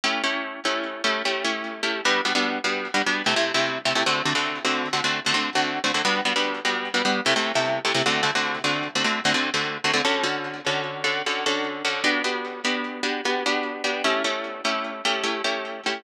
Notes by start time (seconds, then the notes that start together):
0.04 A3 C#4 E4 G4
0.23 A3 C#4 E4 G4
0.65 A3 C#4 E4 G4
1.04 A3 C#4 E4 G4
1.25 A3 C#4 E4 G4
1.44 A3 C#4 E4 G4
1.83 A3 C#4 E4 G4
2.05 G3 B3 D4 F#4
2.25 G3 B3 D4 F#4
2.35 G3 B3 D4 F#4
2.64 G3 B3 D4 F#4
2.94 G3 B3 D4 F#4
3.06 G3 B3 D4 F#4
3.26 C3 A3 E4 G4
3.36 C3 A3 E4 G4
3.54 C3 A3 E4 G4
3.85 C3 A3 E4 G4
3.95 C3 A3 E4 G4
4.06 D3 A3 C4 F#4
4.25 D3 A3 C4 F#4
4.35 D3 A3 C4 F#4
4.64 D3 A3 C4 F#4
4.93 D3 A3 C4 F#4
5.04 D3 A3 C4 F#4
5.26 D3 A3 C4 F#4
5.33 D3 A3 C4 F#4
5.55 D3 A3 C4 F#4
5.84 D3 A3 C4 F#4
5.94 D3 A3 C4 F#4
6.05 G3 B3 D4 F#4
6.25 G3 B3 D4 F#4
6.36 G3 B3 D4 F#4
6.64 G3 B3 D4 F#4
6.94 G3 B3 D4 F#4
7.04 G3 B3 D4 F#4
7.25 C3 A3 E4 G4
7.36 C3 A3 E4 G4
7.55 C3 A3 E4 G4
7.84 C3 A3 E4 G4
7.94 C3 A3 E4 G4
8.06 D3 A3 C4 F#4
8.23 D3 A3 C4 F#4
8.35 D3 A3 C4 F#4
8.64 D3 A3 C4 F#4
8.95 D3 A3 C4 F#4
9.04 D3 A3 C4 F#4
9.25 D3 A3 C4 F#4
9.34 D3 A3 C4 F#4
9.54 D3 A3 C4 F#4
9.84 D3 A3 C4 F#4
9.93 D3 A3 C4 F#4
10.04 D3 C#4 F#4 A4
10.23 D3 C#4 F#4 A4
10.66 D3 C#4 F#4 A4
11.04 D3 C#4 F#4 A4
11.26 D3 C#4 F#4 A4
11.46 D3 C#4 F#4 A4
11.84 D3 C#4 F#4 A4
12.04 B3 D4 F#4 G4
12.24 B3 D4 F#4 G4
12.64 B3 D4 F#4 G4
13.03 B3 D4 F#4 G4
13.25 B3 D4 F#4 G4
13.46 B3 D4 F#4 G4
13.84 B3 D4 F#4 G4
14.04 A3 C#4 E4 G4
14.24 A3 C#4 E4 G4
14.64 A3 C#4 E4 G4
15.05 A3 C#4 E4 G4
15.23 A3 C#4 E4 G4
15.44 A3 C#4 E4 G4
15.86 A3 C#4 E4 G4